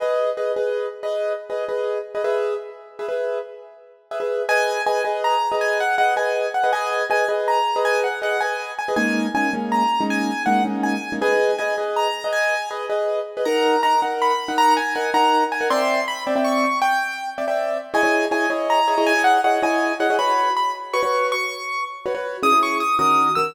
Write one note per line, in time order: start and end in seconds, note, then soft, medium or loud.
0.00 0.30 G#4 medium
0.00 0.30 B4 medium
0.00 0.30 D#5 medium
0.37 0.52 G#4 medium
0.37 0.52 B4 medium
0.37 0.52 D#5 medium
0.56 0.86 G#4 medium
0.56 0.86 B4 medium
0.56 0.86 D#5 medium
1.03 1.33 G#4 medium
1.03 1.33 B4 medium
1.03 1.33 D#5 medium
1.50 1.65 G#4 medium
1.50 1.65 B4 medium
1.50 1.65 D#5 medium
1.69 1.98 G#4 medium
1.69 1.98 B4 medium
1.69 1.98 D#5 medium
2.15 2.22 G#4 medium
2.15 2.22 B4 medium
2.15 2.22 D#5 medium
2.24 2.54 G#4 medium
2.24 2.54 B4 medium
2.24 2.54 E5 medium
2.99 3.07 G#4 medium
2.99 3.07 B4 medium
2.99 3.07 E5 medium
3.08 3.38 G#4 medium
3.08 3.38 B4 medium
3.08 3.38 E5 medium
4.11 4.19 G#4 medium
4.11 4.19 B4 medium
4.11 4.19 E5 medium
4.20 4.42 G#4 medium
4.20 4.42 B4 medium
4.20 4.42 E5 medium
4.49 4.79 G#4 medium
4.49 4.79 B4 medium
4.49 4.79 D#5 medium
4.49 4.82 G#5 loud
4.86 5.01 G#4 medium
4.86 5.01 B4 medium
4.86 5.01 D#5 medium
4.86 5.03 G#5 medium
5.05 5.35 G#4 medium
5.05 5.35 B4 medium
5.05 5.35 D#5 medium
5.24 5.56 A#5 medium
5.52 5.82 G#4 medium
5.52 5.82 B4 medium
5.52 5.82 D#5 medium
5.61 5.78 G#5 medium
5.80 5.95 F#5 medium
5.98 6.13 G#4 medium
5.98 6.13 B4 medium
5.98 6.13 D#5 medium
5.98 6.14 F#5 medium
6.16 6.46 G#4 medium
6.16 6.46 B4 medium
6.16 6.46 D#5 medium
6.16 6.49 G#5 medium
6.54 6.71 F#5 medium
6.64 6.71 G#4 medium
6.64 6.71 B4 medium
6.64 6.71 D#5 medium
6.73 7.03 G#4 medium
6.73 7.03 B4 medium
6.73 7.03 D#5 medium
6.73 7.05 G#5 medium
7.10 7.25 G#4 medium
7.10 7.25 B4 medium
7.10 7.25 D#5 medium
7.10 7.28 G#5 medium
7.29 7.58 G#4 medium
7.29 7.58 B4 medium
7.29 7.58 D#5 medium
7.48 7.82 A#5 medium
7.76 8.06 G#4 medium
7.76 8.06 B4 medium
7.76 8.06 D#5 medium
7.85 8.00 G#5 medium
8.04 8.19 F#5 medium
8.22 8.37 G#4 medium
8.22 8.37 B4 medium
8.22 8.37 D#5 medium
8.22 8.41 F#5 medium
8.41 8.72 G#4 medium
8.41 8.72 B4 medium
8.41 8.72 D#5 medium
8.41 8.71 G#5 medium
8.79 8.94 G#5 medium
8.88 8.96 G#4 medium
8.88 8.96 B4 medium
8.88 8.96 D#5 medium
8.96 9.26 G#3 medium
8.96 9.26 A#3 medium
8.96 9.26 C#4 medium
8.96 9.26 D#4 medium
8.96 9.27 G#5 medium
9.35 9.49 G#3 medium
9.35 9.49 A#3 medium
9.35 9.49 C#4 medium
9.35 9.49 D#4 medium
9.35 9.52 G#5 medium
9.53 9.83 G#3 medium
9.53 9.83 A#3 medium
9.53 9.83 C#4 medium
9.53 9.83 D#4 medium
9.72 10.04 A#5 medium
10.01 10.30 G#3 medium
10.01 10.30 A#3 medium
10.01 10.30 C#4 medium
10.01 10.30 D#4 medium
10.10 10.43 G#5 medium
10.46 10.62 G#3 medium
10.46 10.62 A#3 medium
10.46 10.62 C#4 medium
10.46 10.62 D#4 medium
10.46 10.63 F#5 medium
10.65 10.95 G#3 medium
10.65 10.95 A#3 medium
10.65 10.95 C#4 medium
10.65 10.95 D#4 medium
10.83 11.13 G#5 medium
11.12 11.20 G#3 medium
11.12 11.20 A#3 medium
11.12 11.20 C#4 medium
11.12 11.20 D#4 medium
11.21 11.51 G#4 medium
11.21 11.51 B4 medium
11.21 11.51 D#5 medium
11.21 11.56 G#5 medium
11.58 11.74 G#4 medium
11.58 11.74 B4 medium
11.58 11.74 D#5 medium
11.58 11.76 G#5 medium
11.78 12.08 G#4 medium
11.78 12.08 B4 medium
11.78 12.08 D#5 medium
11.96 12.28 A#5 medium
12.24 12.54 G#4 medium
12.24 12.54 B4 medium
12.24 12.54 D#5 medium
12.33 12.69 G#5 loud
12.71 12.86 G#4 medium
12.71 12.86 B4 medium
12.71 12.86 D#5 medium
12.89 13.19 G#4 medium
12.89 13.19 B4 medium
12.89 13.19 D#5 medium
13.37 13.44 G#4 medium
13.37 13.44 B4 medium
13.37 13.44 D#5 medium
13.45 13.76 D#4 medium
13.45 13.76 A#4 medium
13.45 13.76 F#5 medium
13.45 13.81 A#5 medium
13.83 13.99 D#4 medium
13.83 13.99 A#4 medium
13.83 13.99 F#5 medium
13.83 14.00 A#5 medium
14.02 14.32 D#4 medium
14.02 14.32 A#4 medium
14.02 14.32 F#5 medium
14.22 14.56 B5 medium
14.48 14.78 D#4 medium
14.48 14.78 A#4 medium
14.48 14.78 F#5 medium
14.58 14.74 A#5 loud
14.77 14.94 G#5 medium
14.95 15.11 D#4 medium
14.95 15.11 A#4 medium
14.95 15.11 F#5 medium
14.95 15.10 G#5 medium
15.14 15.44 D#4 medium
15.14 15.44 A#4 medium
15.14 15.44 F#5 medium
15.14 15.44 A#5 medium
15.52 15.70 G#5 medium
15.61 15.68 D#4 medium
15.61 15.68 A#4 medium
15.61 15.68 F#5 medium
15.70 16.00 C4 medium
15.70 16.00 D5 loud
15.70 16.00 E5 loud
15.70 16.00 G5 medium
15.70 16.06 C6 medium
16.08 16.24 B5 medium
16.27 16.34 C4 medium
16.27 16.34 D5 medium
16.27 16.34 E5 medium
16.27 16.34 G5 medium
16.36 16.65 C4 medium
16.36 16.65 D5 medium
16.36 16.65 E5 medium
16.36 16.65 G5 medium
16.44 16.79 C#6 medium
16.82 17.30 G5 loud
17.38 17.45 C4 medium
17.38 17.45 D5 medium
17.38 17.45 E5 medium
17.38 17.45 G5 medium
17.48 17.78 C4 medium
17.48 17.78 D5 medium
17.48 17.78 E5 medium
17.48 17.78 G5 medium
17.94 18.01 E4 medium
17.94 18.01 G#4 medium
17.94 18.01 C#5 medium
17.94 18.01 D#5 medium
17.94 18.25 G#5 loud
18.03 18.26 E4 medium
18.03 18.26 G#4 medium
18.03 18.26 C#5 medium
18.03 18.26 D#5 medium
18.31 18.46 E4 medium
18.31 18.46 G#4 medium
18.31 18.46 C#5 medium
18.31 18.46 D#5 medium
18.31 18.49 G#5 medium
18.50 18.80 E4 medium
18.50 18.80 G#4 medium
18.50 18.80 C#5 medium
18.50 18.80 D#5 medium
18.70 19.06 A#5 medium
18.88 18.95 E4 medium
18.88 18.95 G#4 medium
18.88 18.95 C#5 medium
18.88 18.95 D#5 medium
18.98 19.13 E4 medium
18.98 19.13 G#4 medium
18.98 19.13 C#5 medium
18.98 19.13 D#5 medium
19.07 19.22 G#5 loud
19.16 19.38 E4 medium
19.16 19.38 G#4 medium
19.16 19.38 C#5 medium
19.16 19.38 D#5 medium
19.24 19.41 F#5 medium
19.44 19.59 E4 medium
19.44 19.59 G#4 medium
19.44 19.59 C#5 medium
19.44 19.59 D#5 medium
19.44 19.61 F#5 medium
19.62 19.92 E4 medium
19.62 19.92 G#4 medium
19.62 19.92 C#5 medium
19.62 19.92 D#5 medium
19.62 19.94 G#5 medium
20.00 20.07 E4 medium
20.00 20.07 G#4 medium
20.00 20.07 C#5 medium
20.00 20.07 D#5 medium
20.00 20.16 F#5 medium
20.10 20.17 E4 medium
20.10 20.17 G#4 medium
20.10 20.17 C#5 medium
20.10 20.17 D#5 medium
20.19 20.49 F#4 medium
20.19 20.49 B4 medium
20.19 20.49 C#5 medium
20.19 20.53 B5 medium
20.57 20.73 B5 medium
20.93 21.01 F#4 medium
20.93 21.01 B4 medium
20.93 21.01 C#5 medium
20.93 21.27 C#6 medium
21.03 21.33 F#4 medium
21.03 21.33 B4 medium
21.03 21.33 C#5 medium
21.32 21.84 C#6 medium
22.06 22.13 F#4 medium
22.06 22.13 B4 medium
22.06 22.13 C#5 medium
22.15 22.37 F#4 medium
22.15 22.37 B4 medium
22.15 22.37 C#5 medium
22.43 22.50 C#4 medium
22.43 22.50 E4 medium
22.43 22.50 G#4 medium
22.43 22.60 D#6 medium
22.52 22.82 C#4 medium
22.52 22.82 E4 medium
22.52 22.82 G#4 medium
22.63 22.78 C#6 medium
22.80 22.96 D#6 medium
22.99 23.29 D#3 medium
22.99 23.29 C#4 medium
22.99 23.29 F#4 medium
22.99 23.29 A#4 medium
22.99 23.32 D#6 medium
23.35 23.51 D#3 medium
23.35 23.51 C#4 medium
23.35 23.51 F#4 medium
23.35 23.51 A#4 medium
23.35 23.53 E6 medium